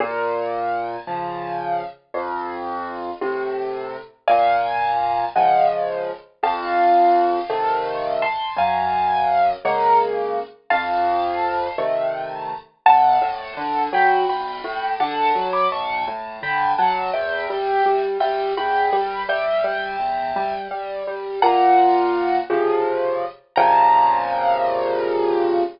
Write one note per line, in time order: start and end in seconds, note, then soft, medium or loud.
0.00 0.97 A#2 loud
1.07 1.82 C#3 medium
1.07 1.82 F3 medium
2.14 3.11 F2 medium
3.21 3.96 A2 medium
3.21 3.96 C3 medium
4.28 5.25 A#2 medium
4.28 5.24 F5 medium
4.28 5.24 G#5 loud
5.36 6.11 C#3 medium
5.36 6.11 F3 medium
5.36 6.11 G#3 medium
5.36 5.66 D#5 medium
5.36 5.66 F#5 medium
6.43 7.39 F2 medium
6.43 8.13 F5 medium
6.43 8.13 A5 medium
7.50 8.25 C3 medium
7.50 8.25 D#3 medium
7.50 8.25 A3 medium
8.22 8.53 A5 medium
8.22 8.53 C6 medium
8.57 9.53 F#2 medium
8.57 9.49 F5 medium
8.57 9.49 G#5 loud
9.65 10.40 C#3 medium
9.65 10.40 G#3 medium
9.65 10.40 A#3 medium
9.65 9.99 F#5 medium
9.65 9.99 A#5 medium
10.70 11.68 F2 medium
10.70 11.73 F5 medium
10.70 11.73 A5 loud
11.78 12.53 C3 medium
11.78 12.53 D#3 soft
11.78 12.53 A3 medium
12.86 13.18 B1 medium
12.86 13.83 F#5 loud
12.86 13.83 A5 loud
13.21 13.54 A2 medium
13.57 13.89 D3 medium
13.93 14.25 F#3 medium
13.93 14.28 G5 medium
13.93 14.28 B5 medium
14.28 14.60 B1 medium
14.28 14.91 G5 medium
14.28 14.91 B5 medium
14.64 14.96 A2 medium
15.00 15.32 D3 medium
15.00 15.48 F#5 loud
15.00 15.48 A5 loud
15.35 15.67 F#3 medium
15.53 15.70 B5 medium
15.53 15.70 D6 loud
15.72 16.04 B1 medium
15.72 16.05 A5 medium
15.72 16.05 C#6 loud
16.07 16.40 A2 medium
16.43 16.75 D3 medium
16.43 16.72 G5 medium
16.43 16.72 B5 loud
16.78 17.11 F#3 medium
16.78 17.10 F#5 loud
16.78 17.10 A5 loud
17.13 17.46 E2 medium
17.13 18.01 E5 medium
17.13 18.01 G5 loud
17.50 17.82 G3 medium
17.86 18.18 G3 medium
18.20 18.53 G3 medium
18.20 18.52 E5 medium
18.20 18.52 G5 medium
18.57 18.89 E2 medium
18.57 19.23 G5 medium
18.57 19.23 B5 loud
18.93 19.25 G3 medium
19.29 19.61 G3 medium
19.29 20.54 E5 loud
19.29 20.54 G5 loud
19.64 19.96 G3 medium
20.00 20.32 E2 medium
20.36 20.68 G3 medium
20.71 21.03 G3 medium
21.07 21.39 G3 medium
21.42 22.39 A#2 medium
21.42 22.36 F#5 loud
21.42 22.36 A#5 loud
22.50 23.25 C3 medium
22.50 23.25 C#3 medium
22.50 23.25 F3 medium
23.56 25.63 A#2 loud
23.56 25.63 C3 medium
23.56 25.63 C#3 loud
23.56 25.63 F3 medium
23.56 25.61 A#5 loud